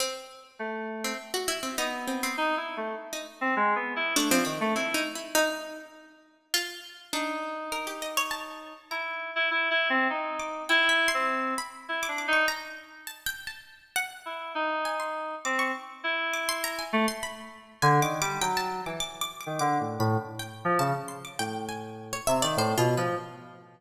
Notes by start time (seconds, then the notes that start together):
0.00 C4
0.59 A3
1.04 C4
1.34 F#4
1.48 E4
1.63 C4
1.78 B3 D#4
2.07 C4
2.23 C4
2.37 D#4
2.57 E4
2.77 A3
3.13 D#4
3.41 C4
3.56 G#3
3.76 B3
3.96 E4
4.16 A3 D4
4.30 F3 C4
4.45 D#3 C4
4.61 A3
4.75 C4 E4
4.94 D#4
5.15 E4
5.35 D#4
6.54 F4
7.13 D4 D#4
7.72 A#4
7.87 G4
8.02 D#5
8.17 C#5
8.31 A5
8.91 E4 A#5
9.36 E4
9.51 E4
9.71 E4
9.90 C4
10.10 D#4
10.39 D6
10.69 E4 G5
10.89 E5
11.08 C6
11.14 C4
11.58 B5
11.89 E4
12.03 D6
12.08 D4
12.18 D6
12.28 D#4
12.33 C#6
12.48 A#5
13.07 A5
13.26 G5
13.47 A5
13.96 F#5
14.26 E4
14.55 D#4
14.85 G#5
15.00 C6
15.45 C4 D6
15.59 C#6
16.04 E4
16.34 D6
16.49 C6
16.64 A#5
16.79 G#5
16.93 A3
17.08 C6
17.23 B5
17.82 D3 G#5
18.02 D#3 D6
18.21 G3 D6
18.41 F#3 G5
18.57 A5
18.86 E3 D6
19.00 D6
19.21 D6
19.41 D6
19.46 D#3
19.59 D3 D6
19.80 A2
19.99 A2 B5
20.39 G5
20.65 F3
20.79 C#3 A5
21.08 C6
21.25 D6
21.39 A2 G5
21.69 G#5
22.13 C#5
22.27 C3 E5
22.42 D#3 D5
22.57 A2 C5
22.77 B2 F4
22.97 F3 B4